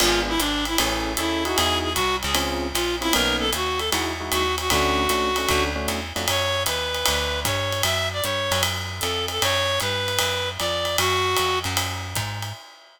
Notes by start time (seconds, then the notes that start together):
0.00 G#1 B3 D4 F4 G#4, crash, ride
0.29 E4
0.39 G#1 D4, hi-hat pedal, ride
0.65 E4, ride
0.78 A1 C#4 E4 G#4 A4, ride
1.17 D#2 C#4 E4 G#4 A4, hi-hat pedal, ride
1.45 D#4 E4 F#4 G#4, ride
1.56 E2 G#4, ride
1.83 G#4
1.94 C2 F#4, kick, hi-hat pedal, ride
2.23 C#2 G#4, ride
2.34 C4 C#4 F4 G#4, ride
2.74 A#1 F4, hi-hat pedal, ride
3.01 C4 C#4 E4 F4 G#4, ride
3.13 B1 A#3 B3 C#4 D#4 A#4, ride
3.39 A4
3.53 D#2 F#4, hi-hat pedal, ride
3.78 A4, ride
3.92 E2 G#3 D#4 E4 F#4, ride
4.20 G#3 D#4 E4 F#4
4.32 D#2 F#4, hi-hat pedal, ride
4.58 F#4, ride
4.70 D2 A3 C#4 D4 F#4, kick, ride
5.09 C#2 A3 C#4 D4 F#4, hi-hat pedal, ride
5.36 A3 C#4 D4 F#4, ride
5.49 D2 A3 C#4 D4 F#4, kick, ride
5.76 A3 C#4 D4 F#4
5.88 E2, hi-hat pedal, ride
6.16 F2 A3 C#4 D4 F#4, ride
6.28 F#2 C#5, ride
6.66 D#2 B4, hi-hat pedal, ride
6.94 ride
7.06 D2, ride
7.45 G2 C#5, kick, hi-hat pedal, ride
7.72 ride
7.83 F#2 E5, ride
8.12 D5
8.23 G2 C#5, hi-hat pedal
8.51 F#2, ride
8.63 ride
9.00 F2 A4, hi-hat pedal, ride
9.28 A4, ride
9.42 F#2 C#5, ride
9.80 G2 B4, hi-hat pedal, ride
10.08 ride
10.19 F#2, ride
10.58 F2 D5, ride
10.85 ride
10.98 F#2 F#4, ride
11.37 F2, hi-hat pedal, ride
11.64 F#2, ride
11.77 ride
12.16 G#2, kick, hi-hat pedal, ride
12.42 ride